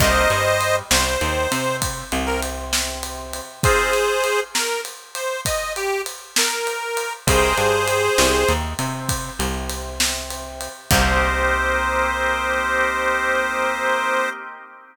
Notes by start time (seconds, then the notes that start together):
0.00 C2 A#3 C4 D#4 G4 C5 D#5, kick, crash
0.30 G2 G3, ride
0.61 ride
0.90 C2 C3 C5, snare
1.21 D#2 D#3, ride
1.52 C3 C4, ride
1.82 kick, ride
2.11 C2 C3, ride
2.26 A#4
2.42 ride
2.73 snare
3.03 ride
3.33 ride
3.63 C4 D#4 F4 G#4 C5, kick, ride
3.93 ride
4.24 ride
4.54 A#4, snare
4.85 ride
5.15 C5, ride
5.45 D#5, kick, ride
5.76 G4, ride
6.06 ride
6.36 A#4, snare
6.67 ride
6.97 ride
7.27 C2 G#4 A#4 C5 D#5 G5, kick, ride
7.57 G2 G3, ride
7.88 ride
8.18 C2 C3, snare
8.47 D#2 D#3, ride
8.79 C3 C4, ride
9.09 kick, ride
9.39 C2 C3, ride
9.69 ride
10.00 snare
10.30 ride
10.61 ride
10.91 C2 A#3 C4 D#4 G4 C5, kick, crash